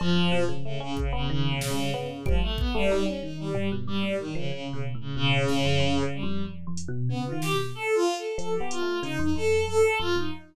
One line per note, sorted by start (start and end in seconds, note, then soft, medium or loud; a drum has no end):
0.00 0.15 F2 medium
0.00 0.43 F3 loud
0.00 cowbell loud
0.16 0.31 F2 medium
0.32 0.47 B2 loud
0.49 0.63 C#3 loud
0.65 0.79 C#3 medium
0.65 0.80 A3 medium
0.80 0.97 C#3 medium
0.80 0.95 C#4 medium
0.97 1.12 C#3 medium
0.97 kick medium
1.13 1.28 C#3 medium
1.13 1.27 B3 loud
1.30 1.59 C#3 medium
1.30 1.49 D#3 loud
1.51 1.71 B2 medium
1.61 1.90 C#3 medium
1.61 snare medium
1.71 1.90 G3 medium
1.94 2.23 C#3 medium
1.94 2.08 B3 loud
1.94 floor tom medium
2.26 2.40 F3 medium
2.26 2.41 G3 loud
2.26 kick loud
2.42 2.56 A3 medium
2.58 2.73 B3 medium
2.58 kick loud
2.74 3.03 G3 loud
2.74 2.89 A3 loud
2.90 3.06 D#4 medium
2.90 clap medium
3.06 3.20 G3 medium
3.06 3.20 C#4 medium
3.22 3.51 D#3 medium
3.22 3.37 D#4 medium
3.39 3.68 G3 medium
3.55 3.69 G3 medium
3.55 floor tom loud
3.72 3.86 B2 medium
3.87 4.02 G2 medium
3.87 4.16 G3 medium
4.03 4.32 A2 medium
4.19 4.33 D#3 medium
4.35 4.51 C#3 medium
4.35 4.50 F3 medium
4.52 4.71 C#3 medium
4.52 4.67 C#3 medium
4.68 4.82 C#3 medium
4.73 4.93 B2 medium
4.95 5.14 A2 medium
5.00 5.15 C#3 medium
5.16 5.45 B2 medium
5.16 6.03 C#3 loud
5.48 5.63 A2 medium
5.48 snare medium
5.65 5.79 F2 medium
5.80 5.99 F2 loud
6.03 6.22 C#3 loud
6.14 6.43 G3 medium
6.23 6.42 F2 loud
6.45 6.64 F2 medium
6.67 6.86 F2 medium
6.77 closed hi-hat medium
6.88 7.08 B2 loud
7.09 7.28 C#3 medium
7.09 7.24 B3 medium
7.26 7.41 F4 medium
7.31 7.51 D#3 medium
7.42 7.57 G4 loud
7.42 snare medium
7.53 7.72 B2 medium
7.75 7.94 A4 loud
7.94 8.14 F4 loud
8.17 8.36 A4 medium
8.38 8.57 F3 medium
8.38 8.53 A4 medium
8.38 closed hi-hat medium
8.54 8.69 G4 medium
8.60 8.80 B3 medium
8.70 8.99 F4 medium
8.70 closed hi-hat medium
8.81 9.00 A3 medium
9.03 9.17 C#3 loud
9.03 9.17 D#4 loud
9.03 closed hi-hat medium
9.19 9.34 F2 medium
9.19 9.34 D#4 medium
9.36 9.65 F2 medium
9.36 9.65 A4 medium
9.67 9.82 F2 medium
9.67 9.97 A4 loud
10.00 10.14 F2 medium
10.00 10.15 F4 loud
10.15 10.30 F2 medium
10.15 10.31 D#4 medium